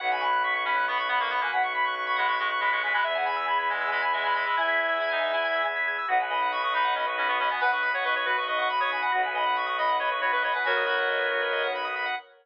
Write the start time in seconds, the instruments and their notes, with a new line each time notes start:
0.00 violin B1, drawbar organ B3 C#4 F#4 F#5, clarinet F#5
0.11 clarinet G#5, drawbar organ B5
0.21 clarinet B5, drawbar organ C#6
0.33 drawbar organ F#6
0.43 clarinet C#6, drawbar organ B6
0.54 clarinet C#6, drawbar organ C#7
0.65 clarinet C#4 B5, drawbar organ B6
0.76 drawbar organ F#6
0.88 clarinet B3 B5, drawbar organ C#6
0.97 drawbar organ B5, clarinet C#6
1.08 clarinet B3 B5, drawbar organ F#5
1.19 clarinet A#3 C#6, drawbar organ B5
1.30 clarinet B3 B5, drawbar organ C#6
1.41 clarinet A#3 G#5, drawbar organ F#6
1.51 violin B1, clarinet F#5, drawbar organ B6
1.63 clarinet C#6, drawbar organ C#7
1.74 clarinet B5, drawbar organ B6
1.84 clarinet C#6, drawbar organ F#6
1.95 drawbar organ C#6, clarinet C#6
2.07 drawbar organ B5, clarinet C#6
2.16 clarinet G#3 B5, drawbar organ F#5
2.28 drawbar organ B5, clarinet C#6
2.38 clarinet G#3 C#6, drawbar organ C#6
2.50 clarinet C#6, drawbar organ F#6
2.60 clarinet G#3 B5, drawbar organ B6
2.71 clarinet G#3 C#6, drawbar organ C#7
2.83 clarinet G#3 G#5, drawbar organ B6
2.93 clarinet G#3 B5, drawbar organ F#6
3.03 violin E2, drawbar organ B3 E4 G#4 E5, clarinet E5
3.15 clarinet F#5, drawbar organ G#5
3.26 clarinet G#5, drawbar organ B5
3.36 drawbar organ E6
3.48 clarinet B5, drawbar organ G#6
3.59 clarinet B5, drawbar organ B6
3.69 clarinet G#3 G#5, drawbar organ G#6
3.81 drawbar organ E6
3.91 clarinet G#3 G#5, drawbar organ B5
4.02 drawbar organ G#5, clarinet B5
4.13 clarinet G#3 G#5, drawbar organ E5
4.24 clarinet G#3 B5, drawbar organ G#5
4.34 clarinet G#3 B5, drawbar organ B5
4.46 clarinet G#3 B5, drawbar organ E6
4.57 violin E2, clarinet E4 E5 G#5, drawbar organ G#6
4.68 drawbar organ B6
4.77 drawbar organ G#6
4.89 drawbar organ E6
5.00 clarinet E4, drawbar organ B5
5.10 clarinet D#4, drawbar organ G#5
5.23 drawbar organ E5
5.33 clarinet E4, drawbar organ G#5
5.44 drawbar organ B5
5.55 drawbar organ E6
5.65 drawbar organ G#6
5.76 drawbar organ B6
5.88 drawbar organ G#6
5.98 drawbar organ E6
6.08 violin B1, drawbar organ B3 D#4 F#4, clarinet F#5
6.20 drawbar organ B4, clarinet G#5
6.30 drawbar organ D#5, clarinet B5
6.42 drawbar organ F#5
6.52 drawbar organ B5, clarinet C#6
6.63 clarinet C#6, drawbar organ D#6
6.74 clarinet D#4 B5, drawbar organ B5
6.84 drawbar organ F#5
6.95 clarinet C#4 B5, drawbar organ D#5
7.06 drawbar organ B4, clarinet C#6
7.17 clarinet C#4 B5, drawbar organ F#4
7.28 clarinet B3 C#6, drawbar organ B4
7.39 clarinet C#4 B5, drawbar organ D#5
7.50 clarinet B3 G#5, drawbar organ F#5
7.61 violin B1, clarinet B4 F#5, drawbar organ B5
7.71 clarinet B4 C#6, drawbar organ D#6
7.82 clarinet B5, drawbar organ B5
7.94 clarinet C#5 C#6, drawbar organ F#5
8.04 clarinet B4 C#6, drawbar organ D#5
8.15 drawbar organ B4, clarinet C#5 C#6
8.25 drawbar organ F#4, clarinet B4 B5
8.37 drawbar organ B4, clarinet C#6
8.47 clarinet D#5 C#6, drawbar organ D#5
8.58 drawbar organ F#5, clarinet C#6
8.70 clarinet B5, drawbar organ B5
8.80 clarinet C#5 C#6, drawbar organ D#6
8.91 clarinet G#5, drawbar organ B5
9.02 drawbar organ F#5, clarinet B5
9.12 violin B1, drawbar organ B3 D#4 F#4, clarinet F#5
9.23 drawbar organ B4, clarinet G#5
9.35 drawbar organ D#5, clarinet B5
9.46 drawbar organ F#5
9.56 drawbar organ B5, clarinet C#6
9.66 clarinet C#6, drawbar organ D#6
9.78 clarinet D#5 B5, drawbar organ B5
9.89 drawbar organ F#5
9.99 clarinet C#5 B5, drawbar organ D#5
10.11 drawbar organ B4, clarinet C#6
10.21 drawbar organ F#4, clarinet C#5 B5
10.32 clarinet B4 C#6, drawbar organ B4
10.42 clarinet C#5 B5, drawbar organ D#5
10.53 clarinet B4 G#5, drawbar organ F#5
10.64 violin B1, clarinet F#4 A#4 C#5, drawbar organ B5
10.77 drawbar organ D#6
10.86 clarinet F#4, drawbar organ B5
10.99 drawbar organ F#5
11.09 drawbar organ D#5
11.19 drawbar organ B4
11.31 drawbar organ F#4
11.42 drawbar organ B4
11.53 drawbar organ D#5
11.63 drawbar organ F#5
11.75 drawbar organ B5
11.85 drawbar organ D#6
11.96 drawbar organ B5
12.06 drawbar organ F#5